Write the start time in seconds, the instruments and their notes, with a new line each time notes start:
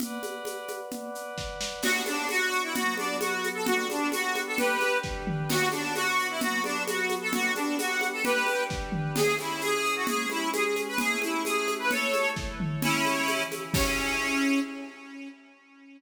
0.00 pad 5 (bowed) B4 D5 F#5, low conga, shaker
0.23 high conga, shaker
0.45 high conga, shaker
0.68 high conga, shaker
0.91 low conga, shaker
1.15 shaker
1.38 kick, snare
1.61 snare
1.82 pad 5 (bowed) B3 D4 F#4, accordion F#4, crash, low conga, shaker
2.06 accordion D4, high conga, shaker
2.29 accordion F#4, high conga, shaker
2.52 shaker
2.63 accordion E4
2.75 pad 5 (bowed) F#3 B3 F#4, accordion F#4, low conga, shaker
2.97 accordion D4, high conga, shaker
3.21 accordion F#4, high conga, shaker
3.44 high conga, shaker
3.54 accordion A4
3.66 pad 5 (bowed) G3 B3 D4, accordion F#4, low conga, shaker
3.89 accordion D4, high conga, shaker
4.12 accordion F#4, high conga, shaker
4.35 high conga, shaker
4.47 accordion A4
4.57 pad 5 (bowed) G3 D4 G4, accordion G4 B4, low conga, shaker
4.80 high conga, shaker
5.03 kick, snare
5.27 mid tom
5.49 pad 5 (bowed) B3 D4 F#4, accordion F#4, crash, low conga, shaker
5.72 accordion D4, high conga, shaker
5.95 accordion F#4, high conga, shaker
6.19 shaker
6.29 accordion E4
6.41 pad 5 (bowed) F#3 B3 F#4, accordion F#4, low conga, shaker
6.64 accordion D4, high conga, shaker
6.87 accordion F#4, high conga, shaker
7.09 high conga, shaker
7.21 accordion A4
7.33 pad 5 (bowed) G3 B3 D4, accordion F#4, low conga, shaker
7.55 accordion D4, high conga, shaker
7.78 accordion F#4, high conga, shaker
8.01 high conga, shaker
8.13 accordion A4
8.24 pad 5 (bowed) G3 D4 G4, accordion G4 B4, low conga, shaker
8.47 high conga, shaker
8.70 kick, snare
8.92 mid tom
9.16 pad 5 (bowed) C#4 E4 G#4, accordion G#4, crash, low conga, shaker
9.39 accordion E4, high conga, shaker
9.61 accordion G#4, high conga, shaker
9.85 shaker
9.96 accordion F#4
10.07 pad 5 (bowed) G#3 C#4 G#4, accordion G#4, low conga, shaker
10.30 accordion E4, high conga, shaker
10.53 accordion G#4, high conga, shaker
10.76 high conga, shaker
10.88 accordion B4
10.98 pad 5 (bowed) A3 C#4 E4, accordion G#4, low conga, shaker
11.22 accordion E4, high conga, shaker
11.45 accordion G#4, high conga, shaker
11.68 high conga, shaker
11.79 accordion B4
11.90 pad 5 (bowed) A3 E4 A4, accordion A4 C#5, low conga, shaker
12.14 high conga, shaker
12.36 kick, snare
12.60 mid tom
12.81 pad 5 (bowed) C#3 G#3 E4, accordion C#4 E4, low conga, shaker
13.05 high conga, shaker
13.28 pad 5 (bowed) C#3 E3 E4, high conga, shaker
13.51 high conga, shaker
13.73 pad 5 (bowed) C#4 E4 G#4, accordion C#4, kick, crash